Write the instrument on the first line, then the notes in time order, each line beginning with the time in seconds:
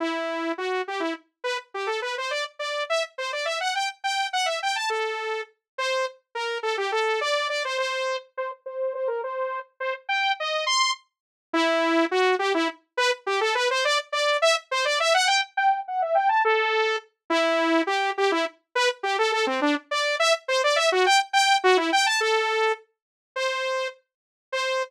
lead 2 (sawtooth)
0.00 E4
0.58 F#4
0.88 G4
1.00 E4
1.44 B4
1.74 G4
1.87 A4
2.02 B4
2.18 C5
2.31 D5
2.59 D5
2.90 E5
3.18 C5
3.33 D5
3.45 E5
3.61 F#5
3.75 G5
4.04 G5
4.33 F#5
4.46 E5
4.63 G5
4.76 A5
4.90 A4
5.78 C5
6.35 A#4
6.63 A4
6.78 G4
6.92 A4
7.21 D5
7.49 D5
7.65 C5
7.78 C5
8.37 C5
8.66 C5
8.95 C5
9.08 A#4
9.24 C5
9.80 C5
10.09 G5
10.40 D#5
10.66 C6
11.53 E4
12.11 F#4
12.39 G4
12.54 E4
12.97 B4
13.26 G4
13.41 A4
13.55 B4
13.71 C5
13.85 D5
14.12 D5
14.42 E5
14.71 C5
14.85 D5
15.00 E5
15.14 F#5
15.27 G5
15.57 G5
15.88 F#5
16.02 E5
16.15 G5
16.29 A5
16.45 A4
17.30 E4
17.87 G4
18.18 G4
18.32 E4
18.75 B4
19.03 G4
19.19 A4
19.32 A4
19.47 C4
19.62 D4
19.91 D5
20.19 E5
20.48 C5
20.64 D5
20.76 E5
20.92 F#4
21.06 G5
21.33 G5
21.64 F#4
21.77 E4
21.93 G5
22.06 A5
22.20 A4
23.36 C5
24.52 C5